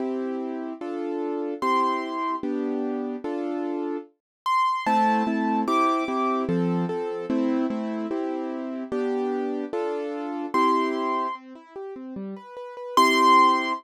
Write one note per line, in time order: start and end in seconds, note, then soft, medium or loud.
0.00 0.73 C4 medium
0.00 0.73 E4 medium
0.00 0.73 G4 medium
0.81 1.54 D4 medium
0.81 1.54 F4 medium
0.81 1.54 A4 medium
1.62 2.35 C4 medium
1.62 2.35 E4 medium
1.62 2.35 G4 medium
1.62 2.36 C6 medium
2.43 3.16 B3 medium
2.43 3.16 D4 medium
2.43 3.16 G4 medium
3.24 3.97 D4 medium
3.24 3.97 F4 medium
3.24 3.97 A4 medium
4.46 4.86 C6 medium
4.86 5.23 A3 loud
4.86 5.23 C4 loud
4.86 5.23 E4 loud
4.86 5.61 A5 medium
5.27 5.64 A3 medium
5.27 5.64 C4 medium
5.27 5.64 E4 medium
5.67 6.04 C4 medium
5.67 6.04 E4 medium
5.67 6.04 G4 medium
5.67 6.43 D6 medium
6.08 6.45 C4 medium
6.08 6.45 E4 medium
6.08 6.45 G4 medium
6.49 6.85 F3 loud
6.49 6.85 C4 medium
6.49 6.85 A4 medium
6.89 7.26 F3 medium
6.89 7.26 C4 medium
6.89 7.26 A4 medium
7.30 7.66 A3 medium
7.30 7.66 C4 loud
7.30 7.66 E4 medium
7.70 8.07 A3 medium
7.70 8.07 C4 medium
7.70 8.07 E4 medium
8.11 8.84 C4 medium
8.11 8.84 E4 medium
8.11 8.84 G4 medium
8.92 9.65 B3 medium
8.92 9.65 D4 medium
8.92 9.65 G4 loud
9.73 10.46 D4 medium
9.73 10.46 F4 medium
9.73 10.46 A4 medium
10.54 11.27 C4 medium
10.54 11.27 E4 medium
10.54 11.27 G4 medium
10.54 11.35 C6 medium
11.35 11.53 C4 medium
11.55 11.74 E4 medium
11.76 11.94 G4 medium
11.96 12.14 C4 medium
12.16 12.34 G3 medium
12.36 12.55 B4 medium
12.57 12.75 B4 medium
12.77 12.95 B4 medium
12.97 13.73 C4 medium
12.97 13.73 E4 medium
12.97 13.73 G4 medium
12.97 13.73 C6 loud